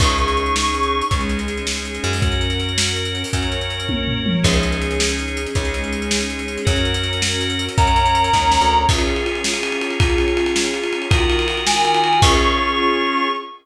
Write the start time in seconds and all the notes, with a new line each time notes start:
0.00 C#2 C#4 D#4 G#4 C#6, kick, crash
0.09 closed hi-hat
0.18 closed hi-hat
0.28 closed hi-hat
0.37 closed hi-hat
0.46 closed hi-hat
0.56 C#6, snare
0.65 closed hi-hat
0.74 closed hi-hat
0.83 closed hi-hat
1.01 closed hi-hat
1.11 C#2 G#3 C#4 D#4 G#4, kick, closed hi-hat
1.21 closed hi-hat
1.29 closed hi-hat
1.39 closed hi-hat
1.48 closed hi-hat
1.57 closed hi-hat
1.67 snare
1.76 closed hi-hat
1.85 closed hi-hat
1.95 closed hi-hat
2.04 F#2, closed hi-hat
2.13 open hi-hat
2.22 C#4 F#4 A#4, kick, closed hi-hat
2.32 closed hi-hat
2.41 closed hi-hat
2.50 closed hi-hat
2.60 closed hi-hat
2.69 closed hi-hat
2.78 snare
2.87 closed hi-hat
2.96 closed hi-hat
3.05 closed hi-hat
3.15 closed hi-hat
3.24 open hi-hat
3.33 F#2 C#4 F#4 A#4 C#5, kick, closed hi-hat
3.43 closed hi-hat
3.52 closed hi-hat
3.61 closed hi-hat
3.70 closed hi-hat
3.80 closed hi-hat
3.89 kick, high tom
4.08 floor tom
4.26 mid tom
4.43 C#2 C#4 D#4 G#4, kick, crash
4.53 closed hi-hat
4.63 closed hi-hat
4.72 closed hi-hat
4.82 closed hi-hat
4.91 closed hi-hat
5.00 snare
5.09 closed hi-hat
5.19 closed hi-hat
5.28 closed hi-hat
5.37 closed hi-hat
5.46 closed hi-hat
5.55 C#2 G#3 C#4 D#4 G#4, kick, closed hi-hat
5.65 closed hi-hat
5.74 closed hi-hat
5.84 closed hi-hat
5.93 closed hi-hat
6.02 closed hi-hat
6.11 snare
6.21 closed hi-hat
6.30 closed hi-hat
6.39 closed hi-hat
6.48 closed hi-hat
6.58 closed hi-hat
6.65 F#2 C#4 F#4 A#4, kick, closed hi-hat
6.76 closed hi-hat
6.85 closed hi-hat
6.94 closed hi-hat
7.03 closed hi-hat
7.13 closed hi-hat
7.22 snare
7.32 closed hi-hat
7.41 closed hi-hat
7.50 closed hi-hat
7.59 closed hi-hat
7.69 closed hi-hat
7.78 F#2 C#4 F#4 A#4 C#5 A#5, kick, closed hi-hat
7.87 closed hi-hat
7.96 closed hi-hat
8.06 closed hi-hat
8.15 closed hi-hat
8.24 closed hi-hat
8.33 D#2, kick, snare
8.52 snare
8.61 D2
8.89 C#4 F4 G#4, kick, crash
8.98 ride
9.07 ride
9.16 ride
9.26 ride
9.35 ride
9.44 snare
9.54 ride
9.63 ride
9.72 ride
9.81 ride
9.91 ride
10.00 kick, ride
10.10 ride
10.18 ride
10.28 ride
10.37 ride
10.46 ride
10.56 snare
10.65 ride
10.74 ride
10.83 ride
10.93 ride
11.02 ride
11.10 D#3 F4 F#4 A#4, kick, ride
11.20 ride
11.30 ride
11.39 ride
11.48 ride
11.57 ride
11.67 G#5, snare
11.76 ride
11.85 ride
11.94 ride
12.04 ride
12.13 ride
12.22 C#4 F4 G#4 C#6, kick, crash